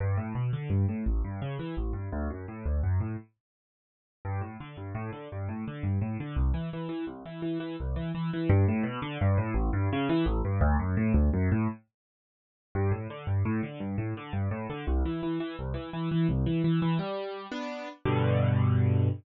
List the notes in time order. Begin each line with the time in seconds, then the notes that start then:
0.00 G2
0.17 A2
0.35 B2
0.53 D3
0.70 G2
0.89 A2
1.06 A1
1.24 G2
1.42 C#3
1.59 E3
1.77 A1
1.93 G2
2.12 D2
2.30 F#2
2.48 A2
2.66 D2
2.83 F#2
3.00 A2
4.25 G2
4.41 A2
4.60 D3
4.77 G2
4.95 A2
5.13 D3
5.32 G2
5.49 A2
5.68 D3
5.83 G2
6.01 A2
6.20 D3
6.36 C2
6.54 E3
6.73 E3
6.89 E3
7.07 C2
7.26 E3
7.42 E3
7.60 E3
7.80 C2
7.96 E3
8.15 E3
8.33 E3
8.49 G2
8.68 A2
8.83 B2
9.02 D3
9.21 G2
9.38 A2
9.54 A1
9.73 G2
9.93 C#3
10.09 E3
10.26 A1
10.45 G2
10.61 D2
10.79 F#2
10.97 A2
11.14 D2
11.33 F#2
11.52 A2
12.75 G2
12.91 A2
13.10 D3
13.27 G2
13.45 A2
13.63 D3
13.80 G2
13.98 A2
14.17 D3
14.33 G2
14.51 A2
14.70 D3
14.87 C2
15.05 E3
15.23 E3
15.40 E3
15.59 C2
15.74 E3
15.93 E3
16.11 E3
16.29 C2
16.46 E3
16.64 E3
16.82 E3
16.99 G3
17.52 B3 D4
18.05 G2 B2 D3